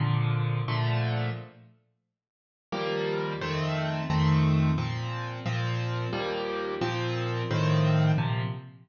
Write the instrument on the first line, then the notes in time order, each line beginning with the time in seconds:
acoustic grand piano
0.00 A#2 D3 F3
0.68 A#2 D3 F3 A3
2.72 D#2 F3 G3 A#3
3.41 F2 D#3 A3 C4
4.10 F2 D#3 A3 C4
4.78 A#2 F3 C4
5.46 A#2 F3 C4
6.13 D#2 F3 G3 A#3
6.81 A#2 F3 C4
7.51 A2 D#3 F3 C4
8.18 A#2 C3 F3